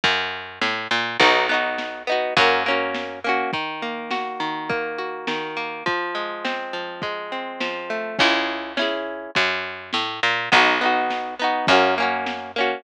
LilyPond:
<<
  \new Staff \with { instrumentName = "Acoustic Guitar (steel)" } { \time 2/4 \key cis \dorian \tempo 4 = 103 r2 | <b dis' fis'>8 <b dis' fis'>4 <b dis' fis'>8 | <ais cis' fis'>8 <ais cis' fis'>4 <ais cis' fis'>8 | \key ees \dorian ees8 bes8 ges'8 ees8 |
bes8 ges'8 ees8 bes8 | f8 aes8 c'8 f8 | aes8 c'8 f8 a8 | \key cis \dorian <cis' e' gis'>4 <cis' e' gis'>4 |
r2 | <b dis' fis'>8 <b dis' fis'>4 <b dis' fis'>8 | <ais cis' fis'>8 <ais cis' fis'>4 <ais cis' fis'>8 | }
  \new Staff \with { instrumentName = "Electric Bass (finger)" } { \clef bass \time 2/4 \key cis \dorian fis,4 a,8 ais,8 | b,,2 | fis,2 | \key ees \dorian r2 |
r2 | r2 | r2 | \key cis \dorian cis,2 |
fis,4 a,8 ais,8 | b,,2 | fis,2 | }
  \new DrumStaff \with { instrumentName = "Drums" } \drummode { \time 2/4 <bd cymr>4 sn4 | <bd cymr>4 sn4 | <bd cymr>4 sn4 | <hh bd>4 sn4 |
<hh bd>4 sn4 | <hh bd>4 sn4 | <hh bd>4 sn4 | <cymc bd>4 sn4 |
<bd cymr>4 sn4 | <bd cymr>4 sn4 | <bd cymr>4 sn4 | }
>>